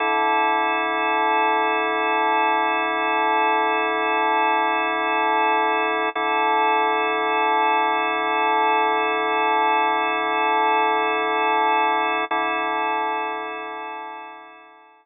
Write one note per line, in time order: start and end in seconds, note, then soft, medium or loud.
0.00 6.09 D3 medium
0.00 6.09 E4 medium
0.00 6.09 A4 medium
6.15 12.25 D3 medium
6.15 12.25 E4 medium
6.15 12.25 A4 medium
12.31 15.06 D3 medium
12.31 15.06 E4 medium
12.31 15.06 A4 medium